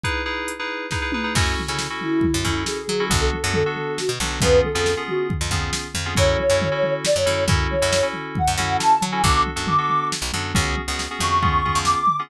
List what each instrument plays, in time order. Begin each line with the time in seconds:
0.04 electric piano 2 D#4 E4 G#4 B4, kick, closed hi-hat
0.26 electric piano 2 D#4 E4 G#4 B4
0.48 closed hi-hat
0.59 electric piano 2 D#4 E4 G#4 B4
0.91 electric piano 2 D#4 E4 G#4 B4, kick, snare
1.02 electric piano 2 D#4 E4 G#4 B4
1.12 electric piano 2 D#4 E4 G#4 B4, mid tom
1.24 electric piano 2 D#4 E4 G#4 B4
1.35 electric bass (finger) F#2, electric piano 2 C#4 E4 F#4 A4, kick, crash
1.59 floor tom
1.68 electric bass (finger) C#3, electric piano 2 C#4 E4 F#4 A4
1.79 snare
1.90 electric piano 2 C#4 E4 F#4 A4
2.01 ocarina E4, floor tom
2.21 kick, floor tom
2.34 electric bass (finger) F#2
2.44 electric bass (finger) F#2, electric piano 2 C#4 E4 F#4 A4, kick, floor tom
2.66 ocarina G#4, snare
2.88 electric bass (finger) F#3, floor tom
3.00 electric piano 2 C#4 E4 F#4 A4
3.10 electric bass (finger) B1, electric piano 2 B3 D4 F#4 A4, kick, floor tom
3.21 ocarina A4
3.33 floor tom
3.44 electric bass (finger) F#2, electric piano 2 B3 D4 F#4 A4
3.54 ocarina A4, floor tom
3.66 electric piano 2 B3 D4 F#4 A4
3.76 floor tom
3.98 ocarina F#4, snare
4.09 electric bass (finger) B2
4.20 electric bass (finger) B1, electric piano 2 B3 D4 F#4 A4, floor tom
4.41 electric bass (finger) F2, electric piano 2 B3 C#4 F4 G#4, ocarina B4, kick, floor tom
4.65 ocarina A4, floor tom
4.75 electric bass (finger) F2, electric piano 2 B3 C#4 F4 G#4
4.86 snare
4.97 electric piano 2 B3 C#4 F4 G#4
5.08 ocarina F#4, floor tom
5.30 kick, floor tom
5.41 electric bass (finger) F2
5.51 electric bass (finger) F2, electric piano 2 B3 C#4 F4 G#4, kick, floor tom
5.73 snare
5.94 electric bass (finger) F2, floor tom
6.06 electric piano 2 B3 C#4 F4 G#4
6.15 electric bass (finger) F#2, electric piano 2 C#4 E4 F#4 A4, ocarina C#5, kick, floor tom
6.39 ocarina C#5, floor tom
6.50 electric bass (finger) F#2, electric piano 2 C#4 E4 F#4 A4
6.62 floor tom
6.72 electric piano 2 C#4 E4 F#4 A4
6.83 floor tom
7.05 ocarina D5, snare
7.16 electric bass (finger) F#2, ocarina C#5
7.26 electric bass (finger) F#2, electric piano 2 C#4 E4 F#4 A4, floor tom
7.48 electric bass (finger) F#2, electric piano 2 C#4 E4 F#4 A4, kick, floor tom
7.71 ocarina C#5, floor tom
7.82 electric bass (finger) F#2, electric piano 2 C#4 E4 F#4 A4
7.93 snare
8.03 electric piano 2 C#4 E4 F#4 A4
8.14 floor tom
8.35 ocarina F#5, kick, floor tom
8.48 electric bass (finger) F#2
8.58 electric bass (finger) F#2, electric piano 2 C#4 E4 F#4 A4, floor tom
8.78 ocarina A5, snare
9.01 electric bass (finger) F#3, floor tom
9.12 electric piano 2 C#4 E4 F#4 A4, ocarina G#5
9.23 electric bass (finger) B1, electric piano 2 B3 D4 F#4 A4, ocarina D6, kick, floor tom
9.47 floor tom
9.56 electric bass (finger) F#2, electric piano 2 B3 D4 F#4 A4
9.67 ocarina D6, floor tom
9.78 electric piano 2 B3 D4 F#4 A4
9.89 floor tom
10.12 snare
10.22 electric bass (finger) B1
10.33 electric bass (finger) F#2, electric piano 2 B3 D4 F#4 A4, floor tom
10.54 electric bass (finger) C#2, electric piano 2 B3 C#4 F#4 G#4, kick, floor tom
10.77 floor tom
10.88 electric bass (finger) C#2, electric piano 2 B3 C#4 F#4 G#4
10.99 snare
11.11 electric piano 2 B3 C#4 F#4 G#4
11.19 electric bass (finger) F2, ocarina C#6, floor tom
11.42 electric piano 2 B3 C#4 F4 G#4, kick, floor tom
11.65 electric piano 2 B3 C#4 F4 G#4, kick, floor tom
11.75 electric bass (finger) F2
11.85 ocarina D6, snare
12.07 floor tom
12.19 electric piano 2 B3 C#4 F4 G#4